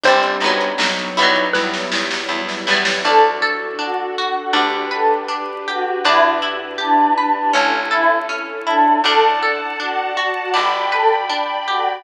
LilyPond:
<<
  \new Staff \with { instrumentName = "Xylophone" } { \time 4/4 \key g \major \tempo 4 = 80 c''4 r4 b'8 r4. | \key d \major r1 | r1 | r1 | }
  \new Staff \with { instrumentName = "Choir Aahs" } { \time 4/4 \key g \major r1 | \key d \major a'16 r8. fis'8 fis'16 fis'16 r8 a'16 r8. fis'8 | e'16 r8. d'8 d'16 d'16 r8 e'16 r8. d'8 | a'16 r8. fis'8 fis'16 fis'16 r8 a'16 r8. fis'8 | }
  \new Staff \with { instrumentName = "Acoustic Grand Piano" } { \time 4/4 \key g \major <g c' d'>4 <fis b dis'>4 <fis g b e'>4 <fis g b e'>4 | \key d \major <d' fis' a'>2 <d' g' b'>2 | r1 | <d'' fis'' a''>2 <d'' g'' b''>2 | }
  \new Staff \with { instrumentName = "Acoustic Guitar (steel)" } { \time 4/4 \key g \major <g c' d'>8 <fis b dis'>4 <fis g b e'>2 <fis g b e'>8 | \key d \major d'8 a'8 d'8 fis'8 d'8 b'8 d'8 g'8 | d'8 e'8 g'8 b'8 cis'8 a'8 cis'8 e'8 | d'8 a'8 d'8 fis'8 d'8 b'8 d'8 g'8 | }
  \new Staff \with { instrumentName = "Electric Bass (finger)" } { \clef bass \time 4/4 \key g \major g,,8 g,,8 b,,8 b,,8 e,8 e,8 e,8 e,8 | \key d \major d,2 d,2 | e,2 a,,2 | d,2 g,,2 | }
  \new Staff \with { instrumentName = "String Ensemble 1" } { \time 4/4 \key g \major <g c' d'>4 <fis b dis'>4 <fis g b e'>4 <e fis g e'>4 | \key d \major <d' fis' a'>2 <d' g' b'>2 | <d' e' g' b'>2 <cis' e' a'>2 | <d'' fis'' a''>2 <d'' g'' b''>2 | }
  \new DrumStaff \with { instrumentName = "Drums" } \drummode { \time 4/4 <hh bd>16 hh16 hh16 hh16 sn16 hh16 hh16 <hh bd>16 <bd sn>16 sn16 sn16 sn16 r16 sn16 sn16 sn16 | r4 r4 r4 r4 | r4 r4 r4 r4 | r4 r4 r4 r4 | }
>>